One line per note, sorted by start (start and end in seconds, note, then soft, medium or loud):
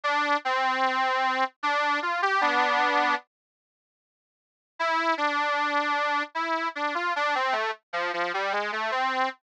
0.03 0.37 D4 loud
0.45 1.44 C4 loud
1.63 2.00 D4 loud
2.02 2.21 F4 medium
2.22 2.41 G4 loud
2.41 3.15 B3 loud
2.41 3.15 D4 loud
4.79 5.14 E4 loud
5.17 6.23 D4 loud
6.35 6.68 E4 medium
6.75 6.94 D4 medium
6.95 7.13 F4 medium
7.16 7.35 D4 loud
7.35 7.54 C4 loud
7.52 7.71 A3 loud
7.93 8.12 F3 loud
8.13 8.32 F3 loud
8.34 8.52 G3 loud
8.52 8.71 G#3 medium
8.72 8.91 A3 loud
8.91 9.29 C4 loud